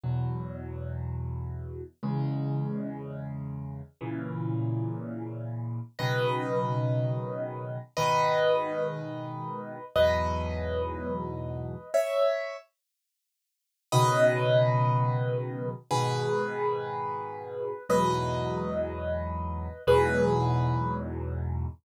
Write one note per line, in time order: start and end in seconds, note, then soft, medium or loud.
0.04 1.82 E2 medium
0.04 1.82 B2 medium
0.04 1.82 F#3 medium
2.03 3.81 E2 medium
2.03 3.81 C#3 loud
2.03 3.81 G#3 medium
4.01 5.79 A#2 medium
4.01 5.79 C#3 medium
4.01 5.79 E3 medium
5.99 7.78 B2 medium
5.99 7.78 C#3 medium
5.99 7.78 D#3 loud
5.99 7.78 F#3 medium
5.99 7.77 B4 medium
5.99 7.77 D#5 medium
7.97 9.76 G#2 medium
7.97 9.76 B2 medium
7.97 9.76 D#3 loud
7.97 9.84 B4 medium
7.97 9.84 D#5 medium
9.96 11.74 E2 medium
9.96 11.74 G#2 medium
9.96 11.74 B2 loud
9.96 11.74 F#3 medium
9.96 11.90 B4 medium
9.96 11.90 D#5 medium
11.94 12.56 C#5 medium
11.94 12.56 E5 medium
13.92 15.71 B2 loud
13.92 15.71 C#3 medium
13.92 15.71 D#3 loud
13.92 15.71 F#3 loud
13.92 15.69 B4 medium
13.92 15.69 D#5 loud
15.91 17.69 G#2 loud
15.91 17.69 B2 loud
15.91 17.69 D#3 medium
15.91 17.83 G#4 medium
15.91 17.83 B4 medium
17.89 19.68 E2 loud
17.89 19.68 G#2 loud
17.89 19.68 B2 loud
17.89 19.68 F#3 loud
17.89 19.81 B4 medium
17.89 19.81 D#5 medium
19.87 21.66 E2 loud
19.87 21.66 G#2 loud
19.87 21.66 B2 loud
19.87 21.66 F#3 loud
19.87 20.95 G#4 medium
19.87 20.95 B4 medium